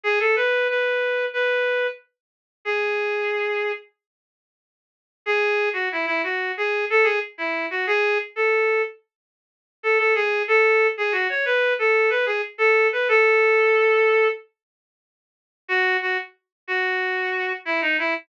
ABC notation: X:1
M:4/4
L:1/16
Q:1/4=92
K:E
V:1 name="Clarinet"
G A B2 B4 B4 z4 | G8 z8 | G3 F E E F2 G2 A G z E2 F | G2 z A3 z6 A A G2 |
A3 G F c B2 A2 B G z A2 B | A8 z8 | F2 F z3 F6 E D E z |]